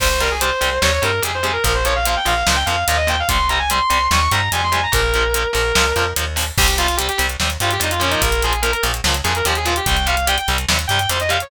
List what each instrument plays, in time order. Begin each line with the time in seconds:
0.00 electric bass (finger) C2, overdriven guitar C3 G3, distortion guitar C5, kick, crash
0.20 overdriven guitar C3 G3, distortion guitar A#4, closed hi-hat
0.31 distortion guitar G#4
0.40 overdriven guitar C3 G3, distortion guitar C5, closed hi-hat
0.61 electric bass (finger) C2, overdriven guitar C3 G3, closed hi-hat
0.82 electric bass (finger) D#2, overdriven guitar C3 G3, distortion guitar C#5, snare
0.93 distortion guitar C#5
1.02 electric bass (finger) G2, overdriven guitar C3 G3, distortion guitar A#4, closed hi-hat
1.22 electric bass (finger) F2, overdriven guitar C3 G3, distortion guitar G#4, closed hi-hat
1.34 distortion guitar C5
1.43 overdriven guitar C3 G3, distortion guitar G#4, closed hi-hat
1.53 distortion guitar A#4
1.64 electric bass (finger) A#1, overdriven guitar A#2 F3, distortion guitar A#4, kick, closed hi-hat
1.74 distortion guitar C5
1.85 overdriven guitar A#2 F3, distortion guitar C#5, closed hi-hat
1.95 distortion guitar F5
2.05 overdriven guitar A#2 F3, distortion guitar F5, closed hi-hat
2.16 distortion guitar G5
2.25 electric bass (finger) A#1, overdriven guitar A#2 F3, distortion guitar F5, closed hi-hat
2.36 distortion guitar F5
2.47 electric bass (finger) C#2, overdriven guitar A#2 F3, snare
2.56 distortion guitar G5
2.65 electric bass (finger) F2, overdriven guitar A#2 F3, distortion guitar F5, closed hi-hat
2.87 electric bass (finger) D#2, overdriven guitar A#2 F3, distortion guitar F5, closed hi-hat
2.97 distortion guitar D#5
3.07 overdriven guitar A#2 F3, distortion guitar G5, closed hi-hat
3.19 distortion guitar F5
3.28 electric bass (finger) C2, overdriven guitar C3 G3, distortion guitar C6, kick, closed hi-hat
3.49 overdriven guitar C3 G3, distortion guitar A#5, closed hi-hat
3.59 distortion guitar G#5
3.70 overdriven guitar C3 G3, distortion guitar C6, closed hi-hat
3.90 electric bass (finger) C2, overdriven guitar C3 G3, closed hi-hat
4.11 electric bass (finger) D#2, overdriven guitar C3 G3, distortion guitar C#6, snare
4.21 distortion guitar C#6
4.32 electric bass (finger) G2, overdriven guitar C3 G3, distortion guitar A#5, closed hi-hat
4.52 electric bass (finger) F2, overdriven guitar C3 G3, distortion guitar G#5, closed hi-hat
4.63 distortion guitar C6
4.72 overdriven guitar C3 G3, distortion guitar G#5, closed hi-hat
4.83 distortion guitar A#5
4.92 electric bass (finger) A#1, overdriven guitar A#2 F3, distortion guitar A#4, kick, closed hi-hat
5.14 overdriven guitar A#2 F3, closed hi-hat
5.34 overdriven guitar A#2 F3, closed hi-hat
5.53 electric bass (finger) A#1, overdriven guitar A#2 F3, distortion guitar A#4, closed hi-hat
5.75 electric bass (finger) C#2, overdriven guitar A#2 F3, snare
5.96 electric bass (finger) F2, overdriven guitar A#2 F3, closed hi-hat
6.16 electric bass (finger) D#2, overdriven guitar A#2 F3, closed hi-hat
6.36 overdriven guitar A#2 F3, open hi-hat
6.58 electric bass (finger) C2, overdriven guitar C3 G3, distortion guitar G4, kick, crash
6.68 closed hi-hat
6.78 overdriven guitar C3 G3, distortion guitar F4, closed hi-hat
6.88 closed hi-hat
6.97 overdriven guitar C3 G3, distortion guitar G4, closed hi-hat
7.09 distortion guitar G4, closed hi-hat
7.18 electric bass (finger) C2, overdriven guitar C3 G3, closed hi-hat
7.29 closed hi-hat
7.40 electric bass (finger) D#2, overdriven guitar C3 G3, snare
7.50 closed hi-hat
7.60 electric bass (finger) G2, overdriven guitar C3 G3, distortion guitar F4, closed hi-hat
7.71 distortion guitar G4, closed hi-hat
7.80 electric bass (finger) F2, overdriven guitar C3 G3, distortion guitar D#4, closed hi-hat
7.91 distortion guitar F4, closed hi-hat
8.00 overdriven guitar A#2 F3, distortion guitar C#4, closed hi-hat
8.10 distortion guitar D#4, closed hi-hat
8.22 electric bass (finger) A#1, distortion guitar A#4, kick, closed hi-hat
8.32 closed hi-hat
8.42 overdriven guitar A#2 F3, distortion guitar G#4, closed hi-hat
8.53 closed hi-hat
8.62 overdriven guitar A#2 F3, distortion guitar A#4, closed hi-hat
8.72 distortion guitar A#4, closed hi-hat
8.83 electric bass (finger) A#1, overdriven guitar A#2 F3, closed hi-hat
8.94 closed hi-hat
9.04 electric bass (finger) C#2, overdriven guitar A#2 F3, snare
9.14 closed hi-hat
9.24 electric bass (finger) F2, overdriven guitar A#2 F3, distortion guitar G#4, closed hi-hat
9.35 distortion guitar A#4, closed hi-hat
9.45 electric bass (finger) D#2, overdriven guitar A#2 F3, distortion guitar G4, closed hi-hat
9.55 distortion guitar G#4, closed hi-hat
9.65 overdriven guitar A#2 F3, distortion guitar F4, closed hi-hat
9.76 distortion guitar G4, closed hi-hat
9.86 electric bass (finger) C2, overdriven guitar C3 G3, distortion guitar G5, kick, closed hi-hat
9.97 closed hi-hat
10.06 overdriven guitar C3 G3, distortion guitar F5, closed hi-hat
10.17 closed hi-hat
10.27 overdriven guitar C3 G3, distortion guitar G5, closed hi-hat
10.38 distortion guitar G5, closed hi-hat
10.48 electric bass (finger) C2, overdriven guitar C3 G3, closed hi-hat
10.58 closed hi-hat
10.68 electric bass (finger) D#2, overdriven guitar C3 G3, snare
10.79 closed hi-hat
10.88 electric bass (finger) G2, overdriven guitar C3 G3, distortion guitar G5, closed hi-hat
10.99 distortion guitar G5, closed hi-hat
11.09 electric bass (finger) F2, overdriven guitar C3 G3, distortion guitar C5, closed hi-hat
11.20 distortion guitar D#5, closed hi-hat
11.29 overdriven guitar C3 G3, distortion guitar F5, closed hi-hat
11.40 distortion guitar C#5, closed hi-hat